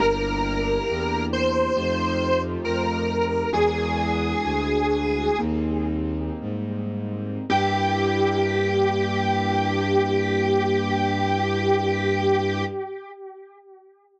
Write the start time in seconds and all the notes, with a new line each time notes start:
0.00 G1 A#3 D4 E4 G4 A#4
0.89 E2
1.33 C5
1.77 F2 A3 D#4 F4 G4
2.65 F2 A#4
3.52 E2 G#3 D4 E4 F#4 G#4
4.44 D2
5.39 D#2 G3 A#3 C4 D#4
6.41 G#2
7.49 G2 A#3 D4 E4 G4